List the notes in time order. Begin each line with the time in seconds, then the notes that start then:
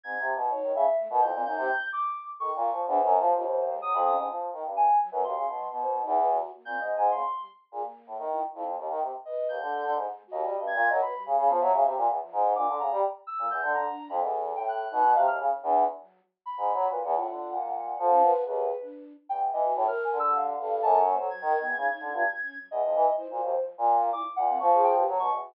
0.04 G#2 C4 G#6
0.19 C3
0.35 B2
0.50 D#4 C#5
0.63 D#3
0.74 C#3 E5
0.98 A3
1.10 B2 A#4
1.21 F2 E4 G6
1.33 A#2 C4
1.45 F#2 D#4 G6
1.57 C3
1.92 D6
2.39 D#3 A4 C#6
2.52 A#2 C#6
2.71 F3
2.87 E2 D4 C5
3.00 F#2 F3
3.19 F3 G3
3.34 D#2 F4
3.72 G#3
3.82 F#3 D#6
3.94 F2 B5
4.05 C#4 D#6
4.17 G#2
4.28 E3 F3
4.53 D#3
4.64 G2
4.76 G#5
5.00 F#3
5.11 F#2 G3 B4
5.23 D#2 F#4 C6
5.35 C#3 E3
5.47 B2
5.55 F#3
5.71 B2 B3
5.83 C5
5.87 B3
6.03 E2 D#4
6.16 B4
6.31 F#4
6.54 A#3
6.65 A#2 C4 G6
6.78 G#2 G#3 D#5
6.97 G#2 G#5
7.11 C#3 A#3 C6
7.37 G3
7.71 A#2 G#4
7.82 A#3
8.07 A2
8.18 D#3
8.32 E4
8.54 F2 E4
8.67 F#3
8.78 D#2
8.89 D#3
9.01 C3
9.25 B4 D#5
9.49 D#2 G6
9.61 D3
9.72 A4
9.84 D3
9.95 G#2 G#3
10.27 F#4
10.31 D#2 D#5
10.43 G3
10.59 G2 A3
10.67 G#6
10.75 A#2
10.89 F#3 A#4 D#5
11.01 B4 B5
11.13 G3
11.26 C#3
11.38 C#3 F5
11.47 F3 B3
11.60 F#3 E5
11.73 C#3
11.85 C3
11.97 A#2
12.08 E2
12.21 F3
12.32 G#2
12.55 A#2 D4 D6
12.67 D3
12.79 C#3 G#3 A#5
12.91 G3
13.27 E6
13.38 A#2 A3
13.50 E2 G6
13.62 D3
13.74 D3 F3 A#5
13.87 D4
14.09 F2 B5
14.21 E2 A4
14.56 A2 G5
14.68 F#6
14.91 B2 D#4
15.05 D#3
15.15 C3 F5
15.27 D#2 F6
15.39 C#3
15.50 D#3
15.63 E2 D4
15.74 F#5
15.99 F#3
16.46 B5
16.57 G#2
16.73 F#3
16.88 A#2 B4
17.04 E2 F#5
17.14 A2 F4
17.28 D3
17.51 A#2
17.63 G#3
17.77 F#3
17.99 F3 A4
18.09 C#4
18.23 B4
18.44 D#2 G#4 B4
18.81 D4
19.29 E2 G5
19.52 E3 D#5
19.64 F#4
19.76 A2 C#5
19.87 A#4 F6
20.04 G#5
20.12 D3
20.19 G3 E6
20.36 F5
20.59 G2 A4
20.82 F#2 A5
20.99 C#6
21.08 A#3
21.14 C5
21.18 F#3 A4
21.29 F#3 G#6
21.41 D#3 A#4
21.53 D#3
21.60 B3
21.65 E2
21.77 C#3 D#4
21.89 D#4
22.00 D3
22.12 G2 F4
22.23 G#3
22.42 C#4
22.55 F#3
22.71 E2 D#5
22.83 F2 E3
22.95 E3 F3
23.17 E4 C5
23.30 A#2 F#4
23.42 D#2 F3
23.78 A#2
24.13 E4 D6
24.36 A#2 F#5
24.48 C4
24.58 F3 A#3 C#6
24.73 G#4
24.84 G5
24.96 G4 B4
25.07 F#3 A3
25.19 B2 C#6
25.31 E2
25.43 F#4